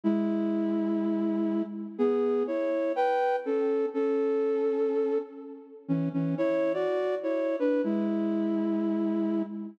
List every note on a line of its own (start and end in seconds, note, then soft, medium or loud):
0.04 1.62 G#3 medium
0.04 1.62 E4 medium
1.98 2.43 B3 medium
1.98 2.43 G#4 medium
2.47 2.92 E4 medium
2.47 2.92 C#5 medium
2.96 3.36 B4 medium
2.96 3.36 G5 medium
3.45 3.86 C#4 medium
3.45 3.86 A4 medium
3.94 5.18 C#4 medium
3.94 5.18 A4 medium
5.88 6.09 E3 medium
5.88 6.09 C#4 medium
6.13 6.35 E3 medium
6.13 6.35 C#4 medium
6.38 6.72 E4 medium
6.38 6.72 C#5 medium
6.74 7.15 F#4 medium
6.74 7.15 D5 medium
7.23 7.56 E4 medium
7.23 7.56 C#5 medium
7.59 7.82 D4 medium
7.59 7.82 B4 medium
7.84 9.43 G#3 medium
7.84 9.43 E4 medium